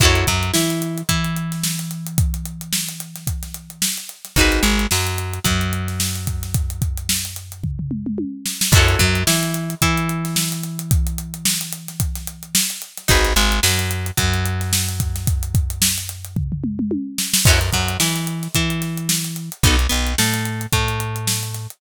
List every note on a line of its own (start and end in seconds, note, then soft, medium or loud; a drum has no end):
0.00 0.24 F#2 loud
0.00 0.27 E4 medium
0.00 0.27 F#4 medium
0.00 0.27 A4 medium
0.00 kick loud
0.00 crash loud
0.05 0.27 C#5 medium
0.15 closed hi-hat medium
0.27 0.52 F#2 loud
0.27 0.51 F#3 medium
0.27 kick medium
0.27 closed hi-hat medium
0.43 closed hi-hat medium
0.54 1.03 E3 medium
0.54 1.01 E4 medium
0.54 snare loud
0.70 closed hi-hat medium
0.82 closed hi-hat medium
0.98 closed hi-hat medium
1.09 3.88 E3 medium
1.09 3.88 E4 medium
1.09 kick medium
1.09 closed hi-hat loud
1.24 closed hi-hat medium
1.36 closed hi-hat medium
1.52 snare soft
1.52 closed hi-hat medium
1.64 snare loud
1.79 closed hi-hat medium
1.91 closed hi-hat medium
2.06 closed hi-hat medium
2.18 kick loud
2.18 closed hi-hat loud
2.34 closed hi-hat medium
2.45 closed hi-hat medium
2.61 closed hi-hat medium
2.73 snare loud
2.89 closed hi-hat medium
3.00 closed hi-hat medium
3.16 snare soft
3.16 closed hi-hat medium
3.27 kick medium
3.27 closed hi-hat loud
3.43 snare soft
3.43 closed hi-hat medium
3.54 closed hi-hat medium
3.70 closed hi-hat medium
3.82 snare loud
3.98 closed hi-hat medium
4.09 closed hi-hat medium
4.25 snare soft
4.25 closed hi-hat medium
4.36 4.60 G#1 loud
4.36 4.63 D#4 medium
4.36 4.63 F#4 medium
4.36 4.63 G#4 medium
4.36 kick medium
4.36 closed hi-hat medium
4.41 4.63 B4 medium
4.52 snare soft
4.52 closed hi-hat medium
4.63 4.87 G#1 loud
4.63 4.86 G#3 medium
4.63 closed hi-hat medium
4.79 closed hi-hat medium
4.91 5.39 F#2 medium
4.91 5.39 F#3 medium
4.91 snare loud
5.07 closed hi-hat medium
5.18 closed hi-hat medium
5.34 closed hi-hat medium
5.44 8.25 F#2 medium
5.44 8.23 F#3 medium
5.44 kick medium
5.44 closed hi-hat loud
5.61 closed hi-hat medium
5.73 closed hi-hat medium
5.88 snare soft
5.88 closed hi-hat medium
6.00 snare loud
6.15 closed hi-hat medium
6.27 kick medium
6.27 closed hi-hat medium
6.43 snare soft
6.43 closed hi-hat medium
6.54 kick loud
6.54 closed hi-hat loud
6.70 closed hi-hat medium
6.82 kick loud
6.82 closed hi-hat medium
6.98 closed hi-hat medium
7.09 snare loud
7.25 closed hi-hat medium
7.36 closed hi-hat medium
7.52 closed hi-hat medium
7.64 kick medium
7.64 floor tom medium
7.79 floor tom medium
7.91 mid tom medium
8.06 mid tom medium
8.18 high tom medium
8.46 snare medium
8.61 snare loud
8.72 8.96 F#2 loud
8.72 8.99 E4 loud
8.72 8.99 F#4 loud
8.72 kick loud
8.72 crash loud
8.76 8.99 A4 loud
8.76 8.99 C#5 loud
8.89 closed hi-hat medium
8.99 9.24 F#2 loud
8.99 9.23 F#3 loud
8.99 kick medium
8.99 closed hi-hat medium
9.15 closed hi-hat medium
9.27 9.75 E3 loud
9.27 9.75 E4 medium
9.27 snare loud
9.43 closed hi-hat medium
9.54 closed hi-hat medium
9.70 closed hi-hat medium
9.82 12.61 E3 loud
9.82 12.61 E4 medium
9.82 kick medium
9.82 closed hi-hat loud
9.98 closed hi-hat medium
10.09 closed hi-hat medium
10.25 snare soft
10.25 closed hi-hat medium
10.36 snare loud
10.52 closed hi-hat medium
10.64 closed hi-hat medium
10.79 closed hi-hat medium
10.91 kick loud
10.91 closed hi-hat loud
11.07 closed hi-hat medium
11.18 closed hi-hat medium
11.34 closed hi-hat medium
11.45 snare loud
11.61 closed hi-hat medium
11.73 closed hi-hat medium
11.88 snare soft
11.88 closed hi-hat medium
12.00 kick medium
12.00 closed hi-hat loud
12.15 snare soft
12.15 closed hi-hat medium
12.27 closed hi-hat medium
12.43 closed hi-hat medium
12.55 snare loud
12.70 closed hi-hat medium
12.82 closed hi-hat medium
12.97 snare soft
12.97 closed hi-hat medium
13.08 13.34 G#1 loud
13.08 13.33 D#4 loud
13.08 13.33 F#4 loud
13.08 13.33 G#4 medium
13.08 13.33 B4 medium
13.08 kick loud
13.08 closed hi-hat loud
13.25 snare soft
13.25 closed hi-hat medium
13.36 13.60 G#1 loud
13.36 13.60 G#3 loud
13.36 closed hi-hat medium
13.52 closed hi-hat medium
13.63 14.11 F#2 loud
13.63 14.11 F#3 medium
13.63 snare loud
13.79 closed hi-hat medium
13.91 closed hi-hat medium
14.06 closed hi-hat medium
14.17 16.98 F#2 loud
14.17 16.96 F#3 medium
14.17 kick medium
14.17 closed hi-hat loud
14.34 closed hi-hat medium
14.46 closed hi-hat medium
14.61 snare soft
14.61 closed hi-hat medium
14.73 snare loud
14.89 closed hi-hat medium
15.00 kick medium
15.00 closed hi-hat loud
15.16 snare soft
15.16 closed hi-hat medium
15.27 kick loud
15.27 closed hi-hat loud
15.43 closed hi-hat medium
15.55 kick loud
15.55 closed hi-hat medium
15.70 closed hi-hat medium
15.82 snare loud
15.98 closed hi-hat medium
16.09 closed hi-hat medium
16.25 closed hi-hat medium
16.36 kick medium
16.36 floor tom medium
16.52 floor tom medium
16.64 mid tom loud
16.79 mid tom loud
16.91 high tom loud
17.18 snare loud
17.34 snare loud
17.45 17.70 F#2 loud
17.45 17.59 C#4 medium
17.45 17.59 E4 medium
17.45 17.59 F#4 medium
17.45 kick loud
17.45 crash loud
17.50 17.59 A4 medium
17.61 snare soft
17.61 closed hi-hat medium
17.73 17.97 F#2 medium
17.73 17.97 F#3 medium
17.73 kick medium
17.73 snare soft
17.73 closed hi-hat medium
17.89 closed hi-hat medium
18.00 18.48 E3 loud
18.00 18.47 E4 medium
18.00 snare loud
18.16 snare soft
18.16 closed hi-hat medium
18.27 closed hi-hat medium
18.43 snare soft
18.43 closed hi-hat medium
18.55 19.50 E3 loud
18.55 19.50 E4 medium
18.55 kick medium
18.55 closed hi-hat loud
18.70 closed hi-hat medium
18.82 snare soft
18.82 closed hi-hat medium
18.98 closed hi-hat medium
19.09 snare loud
19.24 closed hi-hat medium
19.36 closed hi-hat medium
19.52 closed hi-hat medium
19.63 19.87 B1 loud
19.63 19.76 B3 medium
19.63 19.76 D#4 medium
19.63 19.76 F#4 medium
19.63 19.76 A4 medium
19.63 kick loud
19.63 closed hi-hat loud
19.79 closed hi-hat medium
19.89 20.15 B1 medium
19.89 20.13 B3 medium
19.89 closed hi-hat medium
20.07 closed hi-hat medium
20.18 20.67 A2 medium
20.18 20.66 A3 medium
20.18 snare loud
20.34 snare soft
20.34 closed hi-hat medium
20.45 closed hi-hat medium
20.61 closed hi-hat medium
20.73 21.67 A2 medium
20.73 21.67 A3 medium
20.73 kick medium
20.73 closed hi-hat loud
20.88 closed hi-hat medium
21.00 closed hi-hat medium
21.16 closed hi-hat medium
21.27 snare loud
21.43 closed hi-hat medium
21.54 snare soft
21.54 closed hi-hat medium
21.70 closed hi-hat medium